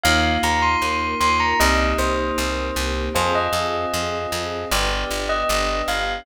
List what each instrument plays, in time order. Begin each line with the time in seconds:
0.03 electric bass (finger) D#2, string ensemble 1 A#3 D#4 F4, electric piano 2 A#3 D#4 F4, tubular bells F5
0.43 electric bass (finger) D#2, tubular bells A#5
0.62 tubular bells C6
0.82 electric bass (finger) D#2, string ensemble 1 A#3 F4 A#4
1.20 electric bass (finger) D#2, tubular bells C6
1.40 tubular bells A#5
1.59 electric bass (finger) C2, electric piano 2 A#3 C4 D#4 G4, string ensemble 1 A#3 C4 D#4 G4, tubular bells D#5
1.98 electric bass (finger) C2, tubular bells C5
2.38 electric bass (finger) C2, string ensemble 1 A#3 C4 G4 A#4
2.76 electric bass (finger) C2
3.14 electric bass (finger) F2, string ensemble 1 C4 F4 G#4, electric piano 2 C5 F5 G#5, tubular bells C5
3.35 tubular bells D#5
3.53 electric bass (finger) F2
3.94 electric bass (finger) F2
4.32 electric bass (finger) F2
4.71 electric bass (finger) G1, string ensemble 1 B3 D4 G4, electric piano 2 B4 D5 G5, tubular bells D5
5.11 electric bass (finger) G1
5.29 tubular bells D#5
5.49 electric bass (finger) G1
5.88 electric bass (finger) G1, tubular bells F5